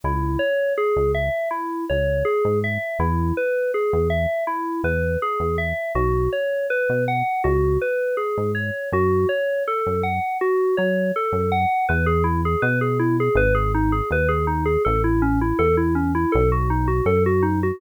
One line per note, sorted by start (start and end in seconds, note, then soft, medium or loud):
0.04 0.37 C#2 medium
0.04 0.39 E4 medium
0.39 0.73 C#5 medium
0.78 1.12 G#4 medium
0.96 1.30 C#2 medium
1.15 1.49 E5 medium
1.51 1.85 E4 medium
1.90 2.23 C#2 medium
1.90 2.24 C#5 medium
2.25 2.59 G#4 medium
2.45 2.78 G#2 medium
2.64 2.98 E5 medium
2.99 3.32 E2 loud
2.99 3.34 E4 medium
3.37 3.71 B4 medium
3.74 4.08 G#4 medium
3.93 4.26 E2 medium
4.10 4.44 E5 medium
4.47 4.81 E4 medium
4.84 5.17 E2 medium
4.84 5.19 B4 medium
5.22 5.56 G#4 loud
5.40 5.73 E2 medium
5.58 5.92 E5 medium
5.95 6.28 B1 medium
5.95 6.29 F#4 medium
6.33 6.67 C#5 medium
6.70 7.04 B4 loud
6.89 7.23 B2 medium
7.08 7.42 F#5 medium
7.44 7.78 C#2 medium
7.44 7.78 F#4 medium
7.81 8.16 B4 medium
8.17 8.51 G#4 medium
8.38 8.71 G#2 medium
8.55 8.89 C#5 medium
8.92 9.26 F#2 medium
8.92 9.27 F#4 loud
9.29 9.63 C#5 medium
9.68 10.02 A4 loud
9.86 10.20 F#2 medium
10.03 10.38 F#5 medium
10.41 10.75 F#4 medium
10.77 11.12 F#3 medium
10.77 11.11 C#5 medium
11.16 11.50 A4 medium
11.32 11.66 F#2 medium
11.52 11.86 F#5 medium
11.89 12.56 E2 loud
11.89 12.06 B4 medium
12.06 12.23 G#4 medium
12.24 12.41 E4 medium
12.45 12.62 G#4 medium
12.62 13.29 B2 medium
12.62 12.79 B4 loud
12.81 12.98 G#4 medium
13.00 13.17 E4 medium
13.20 13.37 G#4 medium
13.35 14.02 G#1 loud
13.35 13.54 B4 loud
13.55 13.72 G#4 medium
13.75 13.92 D#4 medium
13.92 14.09 G#4 medium
14.11 14.77 D#2 medium
14.11 14.29 B4 medium
14.29 14.46 G#4 medium
14.47 14.64 D#4 medium
14.66 14.83 G#4 medium
14.85 15.53 A1 loud
14.85 15.02 A4 loud
15.04 15.21 E4 medium
15.22 15.39 C#4 loud
15.41 15.58 E4 medium
15.59 16.26 E2 medium
15.59 15.76 A4 loud
15.77 15.94 E4 medium
15.95 16.12 C#4 medium
16.15 16.32 E4 medium
16.32 17.01 B1 loud
16.32 16.49 A4 medium
16.52 16.69 F#4 medium
16.70 16.87 D#4 medium
16.88 17.05 F#4 medium
17.05 17.72 F#2 medium
17.05 17.23 A4 medium
17.26 17.43 F#4 medium
17.43 17.60 D#4 medium
17.63 17.80 F#4 medium